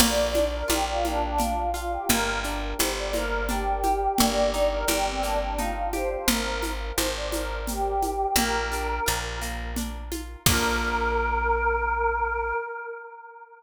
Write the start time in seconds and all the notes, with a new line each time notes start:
0.00 A#1 A#3 D5, crash, low conga, shaker
0.34 D4, high conga, shaker
0.54 A#4
0.68 A#1 F4 G4, high conga, shaker
0.88 F4
1.04 A#3 D4, high conga, shaker
1.22 D4
1.38 D4 F4, low conga, shaker
1.74 F4, shaker
1.91 G4
2.09 G1 A#3 A#4, low conga, shaker
2.44 D4, shaker
2.79 G1 G4 C5, high conga, shaker
2.98 D5
3.13 A#3 A#4, high conga, shaker
3.48 D4 G4, low conga, shaker
3.83 G4, high conga, shaker
4.18 G1 A#3 D5, low conga, shaker
4.53 D#4, shaker
4.72 A#4
4.88 G1 G4, high conga, shaker
5.06 C4
5.22 A#3 D4, shaker
5.42 D4
5.58 D#4 F4, low conga, shaker
5.93 G4 C5, high conga, shaker
6.10 C5
6.28 G#1 A#4, low conga, shaker
6.62 high conga, shaker
6.96 G#1 C5, high conga, shaker
7.16 D5
7.32 A#4, high conga, shaker
7.67 G4, low conga, shaker
8.02 high conga, shaker
8.36 A#1 A#3 A#4, low conga, shaker
8.72 D4, shaker
9.06 A#1 F4, shaker
9.41 A#3, shaker
9.76 D4, low conga, shaker
10.11 F4, high conga, shaker
10.46 A#1 A#3 D4 A#4, kick, crash
10.53 F4